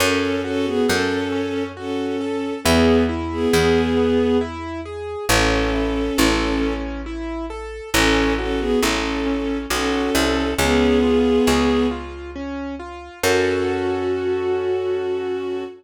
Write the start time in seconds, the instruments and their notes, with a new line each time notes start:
0.00 electric bass (finger) F#2, acoustic grand piano C#4, violin C#4 A4
0.44 violin C#4 A4, acoustic grand piano F#4
0.65 violin B3 G#4
0.88 electric bass (finger) F#2, violin C#4 A4, acoustic grand piano A4
1.32 acoustic grand piano C#4
1.77 violin C#4 A4, acoustic grand piano F#4
2.21 acoustic grand piano A4
2.64 electric bass (finger) E2, violin B3 G#4, acoustic grand piano B3
3.09 acoustic grand piano E4
3.32 violin B3 G#4
3.53 electric bass (finger) E2, violin B3 G#4, acoustic grand piano G#4
3.97 acoustic grand piano B3
4.41 acoustic grand piano E4
4.85 acoustic grand piano G#4
5.29 electric bass (finger) A1, acoustic grand piano C#4, violin C#4 A4
5.73 acoustic grand piano E4
6.18 electric bass (finger) A1, acoustic grand piano A4
6.62 acoustic grand piano C#4
7.06 acoustic grand piano E4
7.50 acoustic grand piano A4
7.94 electric bass (finger) A1, acoustic grand piano C#4, violin C#4 A4
8.38 violin C#4 A4, acoustic grand piano F#4
8.59 violin B3 G#4
8.81 electric bass (finger) A1, violin C#4 A4, acoustic grand piano A4
9.26 acoustic grand piano C#4
9.70 electric bass (finger) B1, violin C#4 A4, acoustic grand piano F#4
10.15 electric bass (finger) C2, acoustic grand piano A4
10.58 electric bass (finger) C#2, violin B3 G#4, acoustic grand piano C#4
11.03 acoustic grand piano F4
11.47 electric bass (finger) C#2, acoustic grand piano G#4
11.91 acoustic grand piano F4
12.35 acoustic grand piano C#4
12.79 acoustic grand piano F4
13.23 electric bass (finger) F#2, acoustic grand piano C#4 F#4 A4, violin F#4